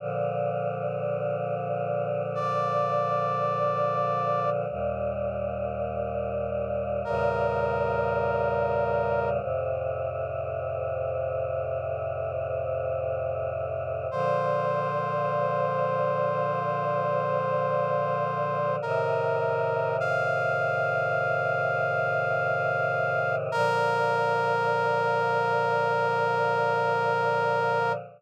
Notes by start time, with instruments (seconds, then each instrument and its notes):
0.00 choir aahs A#2 D3 F3
2.35 brass section D5
4.70 choir aahs D#2 A#2 G3
7.05 choir aahs E2 A#2 C#3 G3, brass section A#4
9.41 choir aahs F2 A2 C3
14.11 choir aahs A#2 D3 F3, brass section C5
18.82 choir aahs A2 C3 D#3, brass section A#4
20.00 brass section F5
23.52 choir aahs A#2 D3 F3, brass section A#4